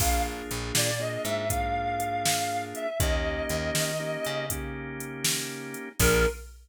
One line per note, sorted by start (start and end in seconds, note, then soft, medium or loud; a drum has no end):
0.00 0.42 A#1 medium
0.00 0.91 A#3 medium
0.00 0.91 D4 medium
0.00 0.91 F4 medium
0.00 0.91 G#4 medium
0.00 0.22 F5 medium
0.00 kick loud
0.00 crash loud
0.51 0.72 A#1 medium
0.51 closed hi-hat medium
0.75 1.18 A#2 medium
0.75 1.00 D5 medium
0.75 snare loud
0.99 1.46 A#3 medium
0.99 1.46 D4 medium
0.99 1.46 F4 medium
0.99 1.46 G#4 medium
0.99 1.23 D#5 medium
1.24 2.73 G#2 medium
1.24 1.48 E5 medium
1.24 closed hi-hat medium
1.50 2.88 A#3 medium
1.50 2.88 D4 medium
1.50 2.88 F4 medium
1.50 2.88 G#4 medium
1.50 2.61 F5 medium
1.50 kick medium
1.50 closed hi-hat loud
2.00 closed hi-hat medium
2.25 snare loud
2.75 2.98 E5 medium
2.75 closed hi-hat medium
3.00 3.42 D#2 medium
3.00 3.92 A#3 medium
3.00 3.92 C#4 medium
3.00 3.92 D#4 medium
3.00 3.92 G4 medium
3.00 4.46 D#5 medium
3.00 kick loud
3.00 closed hi-hat loud
3.49 3.71 D#2 medium
3.49 closed hi-hat medium
3.75 4.17 D#3 medium
3.75 snare loud
4.00 4.46 A#3 medium
4.00 4.46 C#4 medium
4.00 4.46 D#4 medium
4.00 4.46 G4 medium
4.25 5.75 C#3 medium
4.25 closed hi-hat medium
4.50 5.89 A#3 medium
4.50 5.89 C#4 medium
4.50 5.89 D#4 medium
4.50 5.89 G4 medium
4.50 kick medium
4.50 closed hi-hat loud
5.00 closed hi-hat medium
5.24 snare loud
5.74 closed hi-hat medium
5.99 6.26 A#1 loud
5.99 6.27 A#3 medium
5.99 6.27 D4 loud
5.99 6.27 F4 loud
5.99 6.27 G#4 loud
5.99 6.26 A#4 loud
5.99 kick loud
5.99 crash loud